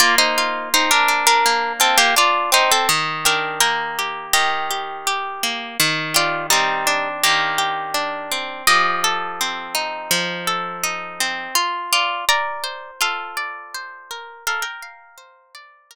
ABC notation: X:1
M:4/4
L:1/16
Q:1/4=83
K:Bb
V:1 name="Acoustic Guitar (steel)"
[Fd] [Ec]3 [Ec] [DB]2 [DB]3 [CA] [B,G] [Fd]2 [Ec] [CA] | z2 [DB]2 [Bg]4 [Ge]8 | z2 [Fd]2 [G,E]4 [B,G]8 | [Ge]6 z10 |
z2 [Fd]2 [db]4 [Af]8 | [Af] [Bg]9 z6 |]
V:2 name="Acoustic Guitar (steel)"
B,2 F2 C2 D2 B,2 F2 D2 C2 | E,2 G2 B,2 G2 E,2 G2 G2 B,2 | E,2 G2 C2 D2 E,2 G2 D2 C2 | F,2 A2 C2 E2 F,2 A2 E2 C2 |
F2 z2 B2 c2 F2 d2 c2 B2 | B2 f2 c2 d2 B2 z6 |]